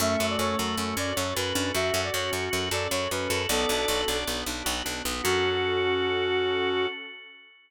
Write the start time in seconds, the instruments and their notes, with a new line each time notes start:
0.00 electric bass (finger) F#2, drawbar organ A3 C#4, pad 2 (warm) C#4 F#4 A4, brass section E5
0.19 electric bass (finger) F#2, drawbar organ F#4
0.29 brass section D5
0.38 electric bass (finger) F#2, drawbar organ A4, brass section C#5
0.58 electric bass (finger) F#2, drawbar organ F#4
0.78 electric bass (finger) F#2, drawbar organ C#4
0.96 electric bass (finger) F#2, drawbar organ C#4 F#4, brass section D5
1.15 electric bass (finger) F#2, drawbar organ A4, brass section C#5
1.35 electric bass (finger) F#2, drawbar organ F#4, brass section B4
1.55 electric bass (finger) F#2, drawbar organ C#4 D4
1.74 electric bass (finger) F#2, drawbar organ F#4, brass section E5
1.94 electric bass (finger) F#2, drawbar organ A4
2.04 brass section D5
2.13 electric bass (finger) F#2, drawbar organ F#4, brass section C#5
2.32 electric bass (finger) F#2, drawbar organ C#4
2.51 electric bass (finger) F#2, drawbar organ F#4
2.71 electric bass (finger) F#2, drawbar organ A4, brass section D5
2.91 electric bass (finger) F#2, drawbar organ F#4, brass section C#5
3.11 electric bass (finger) F#2, drawbar organ C#4, brass section B4
3.30 electric bass (finger) F#2, drawbar organ F#4 A4
3.49 electric bass (finger) B1, pad 2 (warm) B3 D4 F#4, drawbar organ B3 D5, brass section A4
3.69 electric bass (finger) B1, drawbar organ D4
3.88 electric bass (finger) B1, drawbar organ F#4
4.08 electric bass (finger) B1, drawbar organ D4 D5
4.27 electric bass (finger) B1, drawbar organ B3
4.46 electric bass (finger) B1, drawbar organ D4
4.65 electric bass (finger) B1, drawbar organ F#4
4.85 electric bass (finger) B1, drawbar organ D4
5.05 electric bass (finger) B1, drawbar organ B3
5.22 electric bass (finger) F#2, pad 2 (warm) C#4 F#4 A4, drawbar organ C#4 F#4 A4, brass section F#4